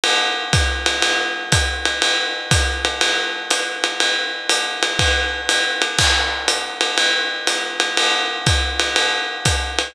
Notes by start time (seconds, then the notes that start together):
0.04 ride
0.53 kick, hi-hat pedal, ride
0.86 ride
1.02 ride
1.52 kick, hi-hat pedal, ride
1.85 ride
2.02 ride
2.51 kick, hi-hat pedal, ride
2.85 ride
3.01 ride
3.51 hi-hat pedal, ride
3.84 ride
4.00 ride
4.49 hi-hat pedal, ride
4.83 ride
4.99 kick, ride
5.49 hi-hat pedal, ride
5.82 ride
5.99 kick, crash, ride
6.48 hi-hat pedal, ride
6.81 ride
6.98 ride
7.47 hi-hat pedal, ride
7.80 ride
7.97 ride
8.46 kick, hi-hat pedal, ride
8.80 ride
8.96 ride
9.45 kick, hi-hat pedal, ride
9.79 ride